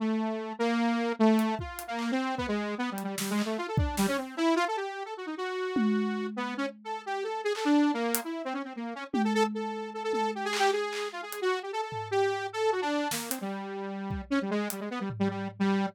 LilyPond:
<<
  \new Staff \with { instrumentName = "Lead 2 (sawtooth)" } { \time 4/4 \tempo 4 = 151 a4. bes4. a4 | \tuplet 3/2 { f'4 bes4 c'4 } b16 aes8. \tuplet 3/2 { b8 g8 g8 } | \tuplet 3/2 { g8 aes8 a8 } f'16 a'16 d'8 g16 des'16 c'8 e'8 f'16 a'16 | g'8. a'16 ges'16 ees'16 ges'2~ ges'8 |
b8 des'16 r8 a'8 g'8 a'8 aes'16 a'16 d'8. | bes8. e'8 c'16 des'16 c'16 bes8 des'16 r16 g'16 a'16 a'16 r16 | a'4 a'16 a'16 a'8 \tuplet 3/2 { g'8 aes'8 g'8 } aes'4 | f'16 aes'8 ges'8 g'16 a'16 a'8. g'4 a'8 |
ges'16 d'8. bes8 c'16 g2~ g16 | des'16 g16 aes8 g16 aes16 b16 g16 r16 g16 g8 r16 g8. | }
  \new DrumStaff \with { instrumentName = "Drums" } \drummode { \time 4/4 r4 r4 r4 r8 hh8 | bd8 hh8 hc4 bd4 r8 hh8 | sn8 hc8 r8 bd8 sn4 cb4 | r4 r4 r8 tommh8 r4 |
r4 r4 r4 hc4 | r8 hh8 r4 r4 tommh4 | r4 r8 tommh8 r8 hc8 r8 hc8 | r8 hh8 r4 tomfh4 r4 |
r4 sn8 hh8 r4 r8 bd8 | r4 hh4 tomfh4 r4 | }
>>